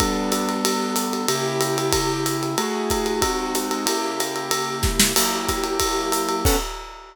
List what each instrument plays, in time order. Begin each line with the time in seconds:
0.00 acoustic grand piano G3 B3 D4 A4, kick, ride
0.32 hi-hat pedal, ride
0.49 ride
0.65 ride
0.96 hi-hat pedal, ride
1.13 ride
1.28 acoustic grand piano C#3 A#3 E4 G4, ride
1.61 hi-hat pedal, ride
1.78 ride
1.93 kick, ride
2.26 hi-hat pedal, ride
2.43 ride
2.58 acoustic grand piano A3 E4 F#4 G#4, ride
2.90 kick, hi-hat pedal, ride
3.06 ride
3.22 acoustic grand piano G#3 C4 D#4 F#4, kick, ride
3.55 hi-hat pedal, ride
3.71 ride
3.86 acoustic grand piano C#3 A#3 E4 G4, ride
4.20 hi-hat pedal, ride
4.36 ride
4.51 ride
4.83 kick, snare
5.00 snare
5.16 acoustic grand piano F#3 A#3 E4 G4, crash, ride
5.49 kick, hi-hat pedal, ride
5.64 ride
5.80 kick, ride
6.12 hi-hat pedal, ride
6.29 ride
6.45 acoustic grand piano B3 C#4 D4 A4, kick, crash